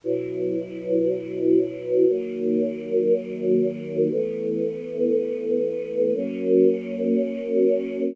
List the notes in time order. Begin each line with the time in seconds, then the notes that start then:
0.04 B2 F#3 E4
2.07 D#3 F#3 A#3
4.11 E3 A3 B3
6.14 F#3 A#3 C#4